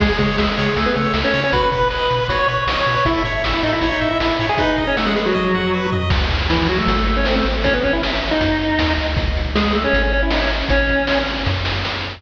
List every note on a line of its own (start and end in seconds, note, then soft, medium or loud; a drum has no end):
0.00 0.12 C#2 medium
0.00 0.09 G#3 medium
0.00 0.09 G#4 medium
0.00 0.17 G#4 medium
0.00 kick loud
0.00 crash loud
0.10 0.18 G#3 medium
0.10 0.18 G#4 medium
0.18 0.29 C#3 medium
0.18 0.37 G#3 medium
0.18 0.37 G#4 medium
0.18 0.37 C#5 medium
0.18 kick medium
0.18 closed hi-hat medium
0.38 0.49 C#2 medium
0.38 0.74 G#3 medium
0.38 0.74 G#4 medium
0.38 0.55 E5 medium
0.38 snare loud
0.57 0.68 C#3 medium
0.57 0.75 C#5 medium
0.57 closed hi-hat medium
0.76 0.87 C#2 medium
0.76 0.86 A3 medium
0.76 0.93 G#4 medium
0.76 0.86 A4 medium
0.76 kick medium
0.76 closed hi-hat loud
0.86 0.95 B3 medium
0.86 0.95 B4 medium
0.95 1.07 C#3 medium
0.95 1.13 A3 medium
0.95 1.13 A4 medium
0.95 1.13 C#5 soft
0.95 closed hi-hat medium
1.14 1.24 C#2 medium
1.14 1.32 E5 medium
1.14 snare loud
1.24 1.41 C#4 medium
1.24 1.41 C#5 medium
1.33 1.44 C#3 medium
1.33 1.51 C#5 medium
1.33 open hi-hat medium
1.44 1.53 C#4 medium
1.44 1.53 C#5 medium
1.52 1.63 B1 medium
1.52 1.70 F#4 medium
1.52 1.62 B4 medium
1.52 1.62 B5 medium
1.52 kick loud
1.52 closed hi-hat loud
1.63 1.71 B4 medium
1.63 1.71 B5 medium
1.72 1.83 B2 medium
1.72 1.88 B4 medium
1.72 1.89 B4 medium
1.72 1.88 B5 medium
1.72 kick medium
1.72 closed hi-hat medium
1.90 2.02 B1 medium
1.90 2.24 B4 medium
1.90 2.09 D#5 medium
1.90 2.24 B5 medium
1.90 snare medium
2.10 2.21 B2 medium
2.10 2.27 B4 medium
2.10 closed hi-hat medium
2.28 2.40 B1 medium
2.28 2.47 F#4 medium
2.28 2.38 C#5 medium
2.28 2.38 C#6 medium
2.28 kick medium
2.28 closed hi-hat loud
2.39 2.48 C#5 medium
2.39 2.48 C#6 loud
2.47 2.58 B2 medium
2.47 2.65 B4 medium
2.47 2.64 C#5 medium
2.47 2.64 C#6 medium
2.47 closed hi-hat medium
2.67 2.77 B1 medium
2.67 2.85 D#5 medium
2.67 snare loud
2.77 2.95 C#5 medium
2.77 2.95 C#6 medium
2.86 2.97 B2 medium
2.86 3.04 B4 medium
2.86 closed hi-hat medium
2.96 3.05 C#5 medium
2.96 3.05 C#6 medium
3.05 3.16 A1 medium
3.05 3.22 E4 medium
3.05 3.23 A4 medium
3.05 3.22 E5 loud
3.05 kick loud
3.05 closed hi-hat loud
3.24 3.34 A2 medium
3.24 3.42 C#5 medium
3.24 kick medium
3.24 closed hi-hat medium
3.43 3.54 A1 medium
3.43 3.61 E5 medium
3.43 snare loud
3.53 3.63 E4 medium
3.53 3.63 E5 medium
3.63 3.73 A2 medium
3.63 3.72 D#4 medium
3.63 3.80 A4 soft
3.63 3.72 D#5 medium
3.63 closed hi-hat medium
3.73 3.89 E4 medium
3.73 3.89 E5 medium
3.81 3.92 A1 medium
3.81 4.00 C#5 medium
3.81 kick medium
3.81 closed hi-hat loud
3.92 4.09 D#4 medium
3.92 4.09 D#5 medium
4.01 4.12 A2 medium
4.01 4.18 E5 medium
4.01 closed hi-hat medium
4.11 4.20 E4 medium
4.11 4.20 E5 medium
4.20 4.31 A1 medium
4.20 4.46 E4 medium
4.20 4.37 A4 medium
4.20 4.46 E5 medium
4.20 snare loud
4.39 4.50 A2 medium
4.39 4.57 C#5 soft
4.39 closed hi-hat medium
4.49 4.58 G#4 medium
4.49 4.58 G#5 medium
4.58 4.84 D#4 medium
4.58 4.76 B4 medium
4.58 4.84 D#5 medium
4.58 kick loud
4.58 closed hi-hat loud
4.77 4.95 D#5 medium
4.77 kick medium
4.77 closed hi-hat medium
4.87 4.96 C#4 medium
4.87 4.96 C#5 medium
4.96 5.06 A3 medium
4.96 5.06 A4 medium
4.96 5.14 F#5 medium
4.96 snare loud
5.07 5.16 G#3 medium
5.07 5.16 G#4 medium
5.16 5.25 G#3 medium
5.16 5.25 G#4 medium
5.16 5.33 B4 medium
5.16 closed hi-hat medium
5.26 5.87 F#3 medium
5.26 5.87 F#4 medium
5.34 5.52 D#5 medium
5.34 kick medium
5.34 high tom medium
5.54 5.72 F#5 medium
5.54 floor tom medium
5.73 5.90 B4 medium
5.92 6.09 D#5 medium
5.92 floor tom loud
6.10 6.82 C#2 loud
6.10 kick loud
6.10 crash loud
6.30 kick loud
6.30 closed hi-hat medium
6.50 6.68 E3 medium
6.50 6.68 E4 medium
6.50 snare loud
6.67 6.78 F#3 medium
6.67 6.78 F#4 medium
6.67 closed hi-hat medium
6.78 6.96 A3 medium
6.78 6.96 A4 medium
6.87 7.42 G#1 loud
6.87 kick loud
6.87 closed hi-hat loud
6.97 7.06 A3 medium
6.97 7.06 A4 medium
7.06 7.16 A3 medium
7.06 7.16 A4 medium
7.06 closed hi-hat medium
7.16 7.26 C#4 medium
7.16 7.26 C#5 medium
7.25 7.35 C4 medium
7.25 7.35 C5 medium
7.25 snare loud
7.36 7.45 A3 medium
7.36 7.45 A4 medium
7.45 8.34 A1 medium
7.45 closed hi-hat medium
7.64 7.73 C#4 medium
7.64 7.73 C#5 loud
7.64 kick loud
7.64 closed hi-hat loud
7.74 7.83 B3 medium
7.74 7.83 B4 medium
7.83 7.93 C#4 medium
7.83 7.93 C#5 medium
7.83 kick loud
7.83 closed hi-hat medium
7.93 8.02 E4 medium
7.93 8.02 E5 medium
8.03 snare loud
8.22 closed hi-hat medium
8.31 8.93 D#4 medium
8.31 8.93 D#5 medium
8.41 8.78 F#2 medium
8.41 kick loud
8.41 closed hi-hat loud
8.61 closed hi-hat medium
8.79 8.96 D#2 medium
8.79 snare loud
8.97 9.15 D2 medium
8.97 closed hi-hat medium
9.16 9.87 C#2 medium
9.16 kick loud
9.16 closed hi-hat loud
9.35 kick medium
9.35 closed hi-hat medium
9.55 9.73 G#3 medium
9.55 9.73 G#4 loud
9.55 snare loud
9.73 9.84 A3 medium
9.73 9.84 A4 medium
9.73 closed hi-hat medium
9.84 10.02 C#4 medium
9.84 10.02 C#5 loud
9.93 10.64 G#1 loud
9.93 kick medium
9.93 closed hi-hat loud
10.03 10.12 C#4 medium
10.03 10.12 C#5 medium
10.13 10.22 C#4 medium
10.13 10.22 C#5 medium
10.13 closed hi-hat medium
10.22 10.32 E4 medium
10.22 10.32 E5 medium
10.30 10.41 D#4 medium
10.30 10.41 D#5 medium
10.30 snare loud
10.41 10.50 C#4 medium
10.41 10.50 C#5 medium
10.51 closed hi-hat medium
10.68 11.40 A1 loud
10.68 11.19 C#4 medium
10.68 11.19 C#5 loud
10.68 kick loud
10.68 closed hi-hat loud
10.89 kick medium
10.89 closed hi-hat medium
11.07 snare loud
11.26 closed hi-hat medium
11.46 12.17 F#2 loud
11.46 kick medium
11.46 snare medium
11.65 snare loud
11.85 snare medium